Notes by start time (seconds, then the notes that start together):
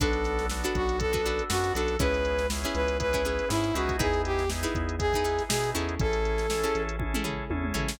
0.00 B1 B3 D4 F#4 A4 B4, kick, closed hi-hat
0.13 closed hi-hat
0.24 snare, closed hi-hat
0.39 snare, closed hi-hat
0.49 B3 D4 F#4 A4, snare
0.64 D4 F#4 A4 B4, closed hi-hat
0.75 B1 F#4, kick, closed hi-hat
0.89 closed hi-hat
0.99 B3 D4 F#4 A4, kick, closed hi-hat
1.13 D4 F#4 A4 B4, kick, closed hi-hat
1.26 D4 F#4 A4 B4, closed hi-hat
1.39 closed hi-hat
1.49 F#2 B3 D4 F#4 A4, snare
1.64 snare, closed hi-hat
1.75 B1 D4 F#4 A4 B4, closed hi-hat
1.88 closed hi-hat
1.99 C#2 B3 C#4 E4 G#4 B4, kick, closed hi-hat
2.14 closed hi-hat
2.25 closed hi-hat
2.39 snare, closed hi-hat
2.50 B3 C#4 E4 G#4, snare
2.64 C#4 E4 G#4 B4, closed hi-hat
2.75 C#2 B4, closed hi-hat
2.88 closed hi-hat
3.00 B3 C#4 E4 G#4 B4, kick, closed hi-hat
3.13 C#4 E4 G#4 B4, kick, closed hi-hat
3.25 C#4 E4 G#4 B4, closed hi-hat
3.39 closed hi-hat
3.49 G#2 B3 C#4 E4 G#4, snare
3.64 closed hi-hat
3.74 C#2 B3 C#4 D#4 E4 F#4 G#4 B4, closed hi-hat
3.89 kick, closed hi-hat
3.99 E2 D#4 E4 G#4 B4, kick, closed hi-hat
4.14 closed hi-hat
4.25 G4, closed hi-hat
4.39 snare, closed hi-hat
4.50 B3 D#4 E4 G#4, snare
4.63 D#4 E4 G#4 B4, closed hi-hat
4.75 E2, kick, closed hi-hat
4.89 closed hi-hat
4.99 B3 D#4 E4 G#4, kick, closed hi-hat
5.13 D#4 E4 G#4 B4, kick, closed hi-hat
5.24 D#4 E4 G#4 B4, closed hi-hat
5.39 snare, closed hi-hat
5.49 B2 B3 D#4 E4 G#4, snare
5.64 closed hi-hat
5.75 E2 C#4 E4 G#4 A4, closed hi-hat
5.89 closed hi-hat
5.99 A1 C#4 E4 G#4 A4, kick, closed hi-hat
6.13 closed hi-hat
6.25 closed hi-hat
6.38 snare, closed hi-hat
6.50 C#4 E4 G#4 A4, snare
6.63 C#4 E4 G#4 A4, closed hi-hat
6.75 A1, closed hi-hat
6.89 closed hi-hat
6.99 C#4 E4 G#4 A4, kick, high tom
7.14 C#4 E4 G#4 A4, mid tom
7.24 C#4 E4 G#4 A4, floor tom
7.50 E2 C#4 E4 G#4 A4, high tom
7.64 mid tom
7.74 A1 C#4 E4 G#4 A4, floor tom
7.88 snare